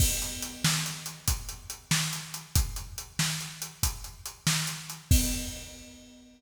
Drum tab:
CC |x-----------|------------|x-----------|
HH |-xx-xxxxx-xx|xxx-xxxxx-xx|------------|
SD |---o-----o--|---o-----o--|------------|
BD |o-----o-----|o-----o-----|o-----------|